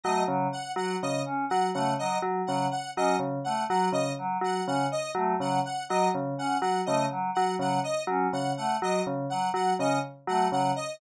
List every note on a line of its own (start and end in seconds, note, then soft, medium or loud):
0.04 0.24 F#3 medium
0.04 0.23 A3 medium
0.04 0.23 D#5 medium
0.28 0.47 C#3 medium
0.28 0.48 F#3 medium
0.53 0.72 F#5 medium
0.76 0.96 F#3 medium
0.76 0.96 F#5 medium
1.02 1.22 C#3 medium
1.02 1.22 D#5 medium
1.26 1.45 C#4 medium
1.50 1.71 F#3 medium
1.50 1.69 F#5 medium
1.74 1.95 C#3 medium
1.74 1.94 A3 medium
1.74 1.93 F#5 medium
1.99 2.18 F#3 medium
1.99 2.18 D#5 medium
2.22 2.42 F#3 medium
2.47 2.68 C#3 medium
2.47 2.67 F#3 medium
2.47 2.66 F#5 medium
2.71 2.91 F#5 medium
2.96 3.17 F#3 medium
2.96 3.16 C#4 medium
2.96 3.16 D#5 medium
3.19 3.39 C#3 medium
3.44 3.65 A3 medium
3.44 3.64 F#5 medium
3.70 3.89 F#3 medium
3.70 3.90 F#3 medium
3.70 3.89 F#5 medium
3.92 4.12 C#3 medium
3.92 4.12 D#5 medium
4.18 4.38 F#3 medium
4.41 4.61 F#3 medium
4.41 4.63 F#5 medium
4.67 4.87 C#3 medium
4.67 4.87 C#4 medium
4.67 4.87 F#5 medium
4.92 5.11 D#5 medium
5.15 5.34 F#3 medium
5.15 5.35 A3 medium
5.40 5.60 C#3 medium
5.40 5.60 F#3 medium
5.40 5.60 F#5 medium
5.65 5.85 F#5 medium
5.89 6.09 F#3 medium
5.89 6.10 F#3 medium
5.89 6.09 D#5 medium
6.15 6.34 C#3 medium
6.38 6.57 C#4 medium
6.38 6.58 F#5 medium
6.61 6.81 F#3 medium
6.61 6.81 F#5 medium
6.86 7.07 C#3 medium
6.86 7.06 A3 medium
6.86 7.05 D#5 medium
7.11 7.30 F#3 medium
7.35 7.56 F#3 medium
7.35 7.54 F#5 medium
7.59 7.79 C#3 medium
7.59 7.79 F#3 medium
7.59 7.80 F#5 medium
7.84 8.03 D#5 medium
8.07 8.27 F#3 medium
8.07 8.28 C#4 medium
8.33 8.53 C#3 medium
8.33 8.52 F#5 medium
8.57 8.77 A3 medium
8.57 8.77 F#5 medium
8.82 9.01 F#3 medium
8.82 9.02 F#3 medium
8.82 9.02 D#5 medium
9.07 9.26 C#3 medium
9.30 9.50 F#3 medium
9.30 9.49 F#5 medium
9.54 9.73 F#3 medium
9.54 9.74 F#5 medium
9.79 9.99 C#3 medium
9.79 9.99 C#4 medium
9.79 9.99 D#5 medium
10.27 10.47 F#3 medium
10.27 10.48 A3 medium
10.27 10.48 F#5 medium
10.52 10.72 C#3 medium
10.52 10.72 F#3 medium
10.52 10.72 F#5 medium
10.76 10.95 D#5 medium